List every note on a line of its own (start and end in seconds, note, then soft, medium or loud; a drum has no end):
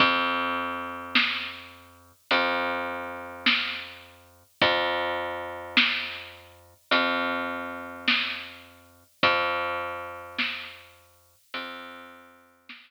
0.00 2.12 F2 medium
0.00 kick medium
0.00 closed hi-hat medium
1.15 snare medium
2.31 4.43 F2 medium
2.31 closed hi-hat medium
3.46 snare medium
4.62 6.74 F2 medium
4.62 kick medium
4.62 closed hi-hat medium
5.77 snare loud
6.91 9.04 F2 medium
6.91 closed hi-hat medium
8.08 snare medium
9.23 11.35 F2 medium
9.23 kick medium
9.23 closed hi-hat medium
10.38 snare medium
11.54 12.91 F2 medium
11.54 closed hi-hat medium
12.69 snare loud